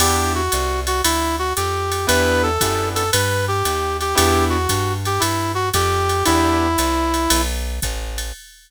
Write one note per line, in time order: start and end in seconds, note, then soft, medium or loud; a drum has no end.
0.00 0.49 E2 loud
0.00 0.41 B3 medium
0.00 0.41 D4 loud
0.00 0.41 E4 loud
0.00 0.33 G4 medium
0.00 0.41 G4 loud
0.00 crash loud
0.00 ride loud
0.35 0.80 F#4 medium
0.52 1.02 C2 medium
0.52 hi-hat pedal loud
0.52 ride loud
0.87 1.01 F#4 medium
0.87 ride medium
1.04 1.53 D2 loud
1.04 1.36 E4 medium
1.04 ride loud
1.39 1.53 F#4 medium
1.56 2.06 F2 loud
1.56 2.06 G4 medium
1.56 hi-hat pedal loud
1.56 ride medium
1.92 ride medium
2.07 2.58 E2 loud
2.07 2.49 B3 loud
2.07 2.49 D4 loud
2.07 2.49 E4 loud
2.07 2.49 G4 loud
2.07 2.42 B4 loud
2.07 ride loud
2.43 2.88 A4 medium
2.61 3.11 F#2 loud
2.61 3.03 B3 loud
2.61 3.03 D4 medium
2.61 3.03 E4 medium
2.61 3.03 G4 loud
2.61 kick medium
2.61 hi-hat pedal loud
2.61 ride loud
2.95 3.10 A4 medium
2.95 ride medium
3.12 3.63 G2 loud
3.12 3.45 B4 medium
3.12 ride loud
3.48 3.97 G4 medium
3.65 4.14 D#2 medium
3.65 hi-hat pedal medium
3.65 ride medium
4.01 4.15 G4 medium
4.01 ride medium
4.15 4.67 E2 loud
4.15 4.57 B3 loud
4.15 4.57 D4 loud
4.15 4.57 E4 loud
4.15 4.57 G4 medium
4.15 4.45 G4 loud
4.15 ride loud
4.50 4.93 F#4 medium
4.69 5.19 G2 loud
4.69 kick medium
4.69 hi-hat pedal loud
4.69 ride loud
5.05 5.21 G4 medium
5.05 ride medium
5.20 5.71 G2 loud
5.20 5.52 E4 medium
5.20 ride loud
5.55 5.69 F#4 medium
5.73 6.23 F2 loud
5.73 6.24 G4 loud
5.73 kick medium
5.73 hi-hat pedal medium
5.73 ride loud
6.09 ride medium
6.25 6.76 E2 loud
6.25 6.68 B3 loud
6.25 6.68 D4 loud
6.25 6.68 E4 loud
6.25 7.41 E4 loud
6.25 6.68 G4 loud
6.25 ride loud
6.78 7.28 C2 loud
6.78 hi-hat pedal loud
6.78 ride loud
7.14 ride medium
7.30 7.80 B1 loud
7.30 ride loud
7.82 8.32 A1 medium
7.82 kick medium
7.82 hi-hat pedal loud
7.82 ride medium
8.18 ride medium